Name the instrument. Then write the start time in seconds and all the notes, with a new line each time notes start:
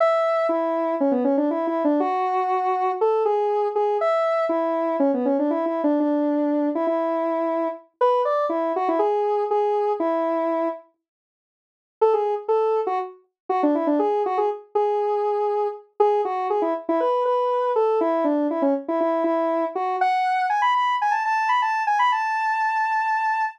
lead 1 (square)
0.00 E5
0.49 E4
1.00 C#4
1.11 B3
1.24 C#4
1.37 D4
1.51 E4
1.67 E4
1.84 D4
2.00 F#4
3.01 A4
3.25 G#4
3.75 G#4
4.01 E5
4.49 E4
5.00 C#4
5.14 B3
5.25 C#4
5.39 D4
5.51 E4
5.66 E4
5.84 D4
6.00 D4
6.75 E4
6.87 E4
8.01 B4
8.25 D5
8.49 E4
8.76 F#4
8.88 E4
8.99 G#4
9.51 G#4
10.00 E4
12.01 A4
12.13 G#4
12.48 A4
12.87 F#4
13.49 F#4
13.63 D4
13.75 E4
13.87 D4
13.99 G#4
14.26 F#4
14.38 G#4
14.75 G#4
16.00 G#4
16.25 F#4
16.50 G#4
16.62 E4
16.89 E4
17.00 B4
17.25 B4
17.76 A4
18.01 E4
18.24 D4
18.51 E4
18.62 C#4
18.88 E4
19.00 E4
19.24 E4
19.75 F#4
20.01 F#5
20.50 G#5
20.62 B5
20.74 B5
21.02 G#5
21.11 A5
21.25 A5
21.49 B5
21.62 A5
21.87 G#5
21.99 B5
22.12 A5